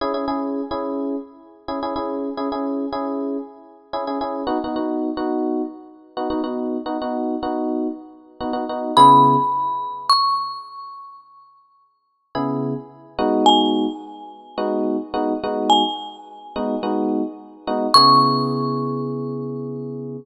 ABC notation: X:1
M:4/4
L:1/16
Q:1/4=107
K:C#m
V:1 name="Marimba"
z16 | z16 | z16 | z16 |
b8 c'8 | z16 | g16 | g16 |
c'16 |]
V:2 name="Electric Piano 1"
[CEG] [CEG] [CEG]3 [CEG]7 [CEG] [CEG] [CEG]2- | [CEG] [CEG] [CEG]3 [CEG]7 [CEG] [CEG] [CEG]2 | [B,DF] [B,DF] [B,DF]3 [B,DF]7 [B,DF] [B,DF] [B,DF]2- | [B,DF] [B,DF] [B,DF]3 [B,DF]7 [B,DF] [B,DF] [B,DF]2 |
[C,B,EG]16- | [C,B,EG]8 [C,B,EG]6 [G,B,DF]2- | [G,B,DF]8 [G,B,DF]4 [G,B,DF]2 [G,B,DF]2- | [G,B,DF]6 [G,B,DF]2 [G,B,DF]6 [G,B,DF]2 |
[C,B,EG]16 |]